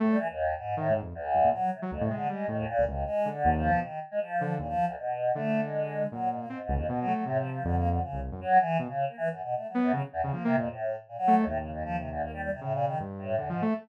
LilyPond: <<
  \new Staff \with { instrumentName = "Choir Aahs" } { \time 6/4 \tempo 4 = 157 a,16 g16 e16 dis,8. gis,8 a,8 r8 d,4 fis8 c16 r16 \tuplet 3/2 { f,8 c8 d8 } | gis8 dis16 dis,16 ais,8 dis,8 \tuplet 3/2 { gis4 d4 f4 } dis8 r16 gis16 f4 | ais,16 f8 d,16 b,4 a8. gis4~ gis16 fis8 gis,16 ais16 \tuplet 3/2 { gis,8 gis,8 f,8 } | \tuplet 3/2 { b,8 fis8 fis8 a,8 f8 f8 d8 ais8 d8 } cis8 r8 fis8 e8 r16 cis8 ais16 |
\tuplet 3/2 { e8 fis,8 b,8 a8 fis8 fis,8 } fis16 r16 e,16 d,16 \tuplet 3/2 { ais8 c8 f,8 } a,8. r16 ais,16 fis8 dis,16 | \tuplet 3/2 { a,8 cis8 f,8 f8 c8 d,8 } ais16 g16 g16 c16 \tuplet 3/2 { a,8 ais,8 dis8 } r8 a,8 \tuplet 3/2 { e,8 gis,8 a8 } | }
  \new Staff \with { instrumentName = "Lead 2 (sawtooth)" } { \time 6/4 a8 r4. \tuplet 3/2 { dis8 gis,8 f,8 } r8 fis,16 ais,16 r8. fis16 d,16 a,16 gis8 | g8 a,8 r16 cis,16 cis,8 r8 d8 dis,8. b,16 r4. d8 | dis,8 r4. d2 ais,4 c'16 r16 cis,16 dis,16 | b,8 a8 c4 f,4 r16 c,8 fis,16 r4 b,16 r8. |
r4. b8 cis16 r8 cis16 \tuplet 3/2 { f8 ais8 ais,8 } r4. a8 | dis,2. cis4 g,4 \tuplet 3/2 { d8 f8 a8 } | }
>>